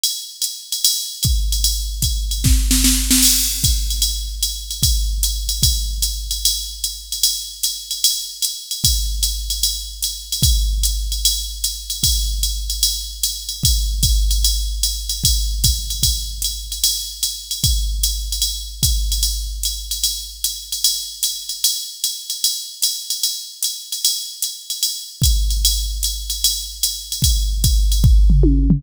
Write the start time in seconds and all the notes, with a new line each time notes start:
0.04 ride
0.42 hi-hat pedal, ride
0.72 ride
0.85 ride
1.23 kick, hi-hat pedal, ride
1.52 ride
1.64 ride
2.02 kick, hi-hat pedal, ride
2.31 ride
2.44 kick, snare
2.71 snare
2.84 snare
3.11 snare
3.23 crash, ride
3.64 kick, hi-hat pedal, ride
3.90 ride
4.02 ride
4.43 hi-hat pedal, ride
4.71 ride
4.83 kick, ride
5.23 hi-hat pedal, ride
5.49 ride
5.63 kick, ride
6.02 hi-hat pedal, ride
6.31 ride
6.45 ride
6.84 hi-hat pedal, ride
7.12 ride
7.23 ride
7.63 hi-hat pedal, ride
7.91 ride
8.04 ride
8.42 hi-hat pedal, ride
8.71 ride
8.84 kick, ride
9.23 hi-hat pedal, ride
9.50 ride
9.63 ride
10.03 hi-hat pedal, ride
10.32 ride
10.43 kick, ride
10.83 hi-hat pedal, ride
11.12 ride
11.25 ride
11.64 hi-hat pedal, ride
11.90 ride
12.03 kick, ride
12.43 hi-hat pedal, ride
12.70 ride
12.83 ride
13.23 hi-hat pedal, ride
13.49 ride
13.63 kick, ride
14.03 kick, hi-hat pedal, ride
14.31 ride
14.44 ride
14.83 hi-hat pedal, ride
15.09 ride
15.24 kick, ride
15.64 kick, hi-hat pedal, ride
15.90 ride
16.03 kick, ride
16.42 hi-hat pedal, ride
16.72 ride
16.84 ride
17.23 hi-hat pedal, ride
17.51 ride
17.64 kick, ride
18.03 hi-hat pedal, ride
18.32 ride
18.42 ride
18.83 kick, hi-hat pedal, ride
19.12 ride
19.23 ride
19.63 hi-hat pedal, ride
19.91 ride
20.04 ride
20.44 hi-hat pedal, ride
20.72 ride
20.84 ride
21.23 hi-hat pedal, ride
21.49 ride
21.64 ride
22.04 hi-hat pedal, ride
22.30 ride
22.44 ride
22.82 hi-hat pedal, ride
23.10 ride
23.23 ride
23.62 hi-hat pedal, ride
23.92 ride
24.05 ride
24.42 hi-hat pedal, ride
24.70 ride
24.83 ride
25.22 kick, hi-hat pedal, ride
25.50 ride
25.65 ride
26.03 hi-hat pedal, ride
26.30 ride
26.44 ride
26.83 hi-hat pedal, ride
27.12 ride
27.22 kick, ride
27.64 kick, hi-hat pedal, ride
27.92 ride
28.04 kick
28.30 floor tom
28.43 high tom
28.70 floor tom